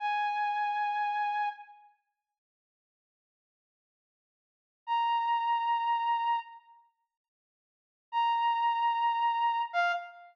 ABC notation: X:1
M:3/4
L:1/8
Q:1/4=111
K:Fdor
V:1 name="Brass Section"
a6 | z6 | z6 | b6 |
z6 | b6 | f2 z4 |]